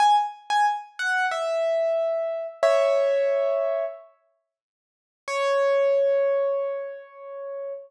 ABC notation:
X:1
M:4/4
L:1/16
Q:1/4=91
K:C#m
V:1 name="Acoustic Grand Piano"
g z2 g z2 f2 e8 | [ce]8 z8 | c16 |]